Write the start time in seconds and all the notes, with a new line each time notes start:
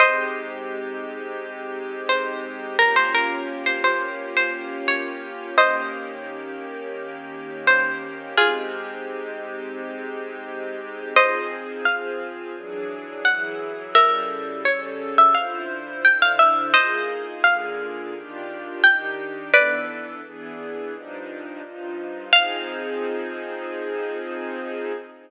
0.00 G#3 C4 D#4 G4 C5 D#5
2.09 C5
2.79 A#3 C#4 F4 G4 A#4
2.96 C5
3.15 A#4
3.66 C5
3.84 C5
4.37 C5
4.88 C#5
5.58 D#3 A#3 C#4 G4 C5 D#5
7.67 C5
8.37 G#3 C4 D#4 F4 G4 G#4
11.16 F3 C4 D#4 G#4 C5 D#5
11.85 F3 C4 F4 G#4 F5
12.56 E3 F#3 D4 G#4
13.25 E3 F#3 E4 G#4 F#5
13.95 C#3 G3 E4 A4 A#4 E5
14.65 C#3 G3 C#4 A4 C#5
15.18 E5
15.35 D3 E4 F4 C5 F5
16.04 D3 D4 E4 C5 G5
16.22 F5
16.39 E5
16.73 A#3 D#4 F4 G#4 C5 D#5
17.44 D3 A#3 F4 G#4 F5
18.14 D#3 D4 F4 G4
18.83 D#3 D4 D#4 G4 G5
19.52 E3 B3 D4 A4 B4 D5
20.24 E3 B3 D4 G#4
20.92 G2 F3 D4 D#4
21.63 G2 F3 D#4 F4
22.33 F3 C4 D#4 G#4 F5